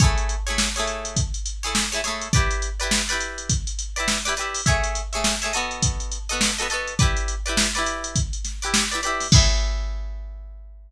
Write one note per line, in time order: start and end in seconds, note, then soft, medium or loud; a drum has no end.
0.00 0.36 A3 loud
0.00 0.36 E4 loud
0.00 0.36 G#4 loud
0.00 0.36 C#5 loud
0.00 kick loud
0.00 closed hi-hat medium
0.18 closed hi-hat medium
0.29 closed hi-hat medium
0.47 0.69 A3 loud
0.47 0.69 E4 medium
0.47 0.69 G#4 medium
0.47 0.69 C#5 loud
0.47 closed hi-hat medium
0.58 snare medium
0.76 1.20 A3 loud
0.76 1.20 E4 loud
0.76 1.20 G#4 loud
0.76 1.20 C#5 loud
0.76 closed hi-hat medium
0.87 closed hi-hat medium
1.05 closed hi-hat medium
1.17 kick medium
1.17 closed hi-hat medium
1.34 closed hi-hat medium
1.46 closed hi-hat medium
1.63 1.85 A3 loud
1.63 1.85 E4 loud
1.63 1.85 G#4 loud
1.63 1.85 C#5 medium
1.63 closed hi-hat medium
1.75 snare medium
1.92 2.01 A3 loud
1.92 2.01 E4 loud
1.92 2.01 G#4 loud
1.92 2.01 C#5 loud
1.92 closed hi-hat medium
2.04 2.29 A3 loud
2.04 2.29 E4 medium
2.04 2.29 G#4 loud
2.04 2.29 C#5 loud
2.04 snare soft
2.04 closed hi-hat medium
2.21 closed hi-hat medium
2.33 2.69 E4 loud
2.33 2.69 G4 loud
2.33 2.69 B4 loud
2.33 2.69 D5 loud
2.33 kick medium
2.33 closed hi-hat medium
2.51 closed hi-hat medium
2.62 closed hi-hat medium
2.80 3.02 E4 loud
2.80 3.02 G4 loud
2.80 3.02 B4 loud
2.80 3.02 D5 medium
2.80 closed hi-hat medium
2.91 snare medium
3.09 3.53 E4 medium
3.09 3.53 G4 loud
3.09 3.53 B4 loud
3.09 3.53 D5 loud
3.09 closed hi-hat medium
3.21 closed hi-hat medium
3.38 closed hi-hat medium
3.50 kick medium
3.50 closed hi-hat medium
3.67 closed hi-hat medium
3.79 closed hi-hat medium
3.96 4.18 E4 loud
3.96 4.18 G4 loud
3.96 4.18 B4 medium
3.96 4.18 D5 medium
3.96 closed hi-hat medium
4.08 snare medium
4.25 4.34 E4 loud
4.25 4.34 G4 loud
4.25 4.34 B4 medium
4.25 4.34 D5 loud
4.25 snare soft
4.25 closed hi-hat medium
4.37 4.62 E4 medium
4.37 4.62 G4 loud
4.37 4.62 B4 loud
4.37 4.62 D5 medium
4.37 closed hi-hat medium
4.54 open hi-hat medium
4.66 5.02 A3 loud
4.66 5.02 G#4 loud
4.66 5.02 C#5 loud
4.66 5.02 E5 loud
4.66 kick medium
4.66 closed hi-hat medium
4.84 closed hi-hat medium
4.95 closed hi-hat medium
5.13 5.35 A3 loud
5.13 5.35 G#4 loud
5.13 5.35 C#5 medium
5.13 5.35 E5 medium
5.13 closed hi-hat medium
5.24 snare medium
5.42 5.53 A3 loud
5.42 5.53 G#4 loud
5.42 5.53 C#5 loud
5.42 5.53 E5 loud
5.42 closed hi-hat medium
5.53 6.18 B3 loud
5.53 6.18 F#4 loud
5.53 6.18 A4 loud
5.53 6.18 D#5 loud
5.53 closed hi-hat medium
5.71 closed hi-hat medium
5.83 kick medium
5.83 closed hi-hat loud
6.00 closed hi-hat medium
6.12 closed hi-hat medium
6.29 6.51 B3 loud
6.29 6.51 F#4 loud
6.29 6.51 A4 loud
6.29 6.51 D#5 medium
6.29 closed hi-hat medium
6.41 snare medium
6.58 6.68 B3 loud
6.58 6.68 F#4 loud
6.58 6.68 A4 loud
6.58 6.68 D#5 loud
6.58 closed hi-hat medium
6.70 6.94 B3 loud
6.70 6.94 F#4 loud
6.70 6.94 A4 loud
6.70 6.94 D#5 loud
6.70 closed hi-hat medium
6.87 closed hi-hat medium
6.99 7.35 E4 loud
6.99 7.35 G4 loud
6.99 7.35 B4 loud
6.99 7.35 D5 loud
6.99 kick medium
6.99 closed hi-hat medium
7.17 closed hi-hat medium
7.28 closed hi-hat medium
7.46 7.68 E4 loud
7.46 7.68 G4 loud
7.46 7.68 B4 loud
7.46 7.68 D5 medium
7.46 closed hi-hat medium
7.57 snare loud
7.75 8.19 E4 loud
7.75 8.19 G4 medium
7.75 8.19 B4 loud
7.75 8.19 D5 loud
7.75 snare soft
7.75 closed hi-hat medium
7.86 closed hi-hat medium
8.04 closed hi-hat medium
8.16 kick medium
8.16 closed hi-hat medium
8.33 closed hi-hat medium
8.45 snare soft
8.45 closed hi-hat medium
8.62 8.84 E4 loud
8.62 8.84 G4 loud
8.62 8.84 B4 loud
8.62 8.84 D5 loud
8.62 closed hi-hat medium
8.74 snare loud
8.91 9.01 E4 loud
8.91 9.01 G4 medium
8.91 9.01 B4 loud
8.91 9.01 D5 loud
8.91 closed hi-hat medium
9.03 9.27 E4 loud
9.03 9.27 G4 loud
9.03 9.27 B4 loud
9.03 9.27 D5 loud
9.03 closed hi-hat medium
9.20 snare soft
9.20 open hi-hat medium
9.32 10.91 A3 loud
9.32 10.91 E4 loud
9.32 10.91 G#4 loud
9.32 10.91 C#5 loud
9.32 kick loud
9.32 crash loud